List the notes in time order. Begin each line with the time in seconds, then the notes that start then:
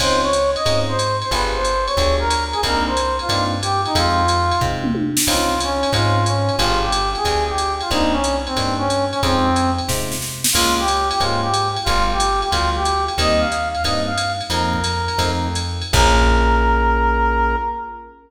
0.00 C#2 C4 C#4 D#4 F4 C5, kick, crash, ride
0.23 C#5
0.33 hi-hat pedal, ride
0.55 D#5, ride
0.66 G#2 C4 C#4 D#4 F4, kick, ride
0.88 C5
0.99 hi-hat pedal, ride
1.21 C5, ride
1.31 G1 B3 F4 G4 G#4 B4, kick, ride
1.55 C5
1.64 hi-hat pedal, ride
1.86 C#5, ride
1.97 D2 B3 F4 G4 G#4, kick, ride
2.19 A#4
2.30 hi-hat pedal, ride
2.53 G#4, ride
2.63 C2 A#3 C4 D4 D#4 A#4, kick, ride
2.87 C5
2.97 hi-hat pedal, ride
3.19 F4, ride
3.29 G2 A#3 C4 D4 D#4, kick, ride
3.62 G4, hi-hat pedal, ride
3.85 D#4, ride
3.95 F2 G#3 C4 D#4 F4, kick, ride
4.28 hi-hat pedal, ride
4.51 ride
4.61 C3 G#3 C4 D#4 F4, kick
4.84 mid tom
4.95 high tom
5.17 snare
5.27 C#2 C4 C#4 D#4 F4, kick, crash, ride
5.60 C#4, hi-hat pedal, ride
5.83 ride
5.93 G#2 C4 C#4 D#4 F4, kick, ride
6.25 C#4, hi-hat pedal, ride
6.49 ride
6.58 G1 B3 F4 G4 G#4, kick, ride
6.82 G4
6.92 hi-hat pedal, ride
7.15 G#4, ride
7.25 D2 B3 F4 G4 G#4, kick, ride
7.47 G4
7.58 hi-hat pedal, ride
7.81 F4, ride
7.91 C2 A#3 C4 D4 D#4, kick, ride
8.12 C#4
8.24 hi-hat pedal, ride
8.46 C4, ride
8.56 G2 A#3 C4 D4 D#4, kick, ride
8.78 C#4
8.90 hi-hat pedal, ride
9.11 C#4, ride
9.23 F2 G#3 C4 D#4 F4, kick, ride
9.56 hi-hat pedal, ride
9.78 ride
9.88 C3 G#3 C4 D#4 F4, kick, snare
10.12 snare
10.22 snare
10.44 snare
10.53 C#2 G#3 A#3 C#4 F4, kick, crash, ride
10.78 G4
10.88 hi-hat pedal, ride
11.11 G4, ride
11.20 G#2 G#3 A#3 C#4 F4, kick, ride
11.41 G4
11.54 hi-hat pedal, ride
11.76 ride
11.84 G1 G3 A3 B3 F4, kick, ride
12.11 G4
12.20 hi-hat pedal, ride
12.41 G4, ride
12.50 D2 G3 A3 B3 F4, kick, ride
12.74 G4
12.85 hi-hat pedal, ride
13.08 ride
13.18 D#2 G3 A#3 C4 D#4 D#5, kick, ride
13.40 F5
13.52 hi-hat pedal, ride
13.74 F5, ride
13.84 G2 G3 A#3 C4 D#4 D#5, kick, ride
14.06 F5
14.18 hi-hat pedal, ride
14.41 ride
14.50 F2 F3 A#3 C4 D#4 A#4, ride
14.73 kick
14.84 hi-hat pedal, ride
15.08 ride
15.18 F2 F3 A3 C4 D#4, kick, ride
15.55 hi-hat pedal, ride
15.82 ride
15.93 A#1 A#3 C#4 F4 G#4 A#4, kick, crash